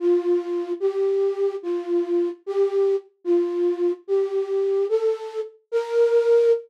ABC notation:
X:1
M:6/8
L:1/8
Q:3/8=147
K:Bb
V:1 name="Flute"
F6 | G6 | F6 | G4 z2 |
F6 | G6 | A4 z2 | B6 |]